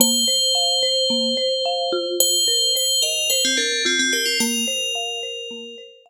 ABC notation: X:1
M:4/4
L:1/16
Q:1/4=109
K:Bb
V:1 name="Tubular Bells"
c16 | c4 c2 B2 c C D2 C C G F | B12 z4 |]
V:2 name="Marimba"
B,2 c2 f2 c2 B,2 c2 f2 F2- | F2 B2 c2 e2 c2 B2 F2 B2 | B,2 c2 f2 c2 B,2 c2 f2 z2 |]